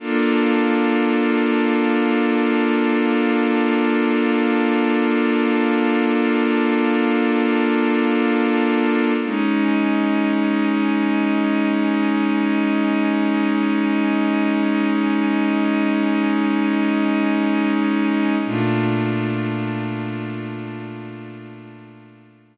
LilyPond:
\new Staff { \time 4/4 \key bes \mixolydian \tempo 4 = 52 <bes d' f' a'>1~ | <bes d' f' a'>1 | <aes des' ees'>1~ | <aes des' ees'>1 |
<bes, a d' f'>1 | }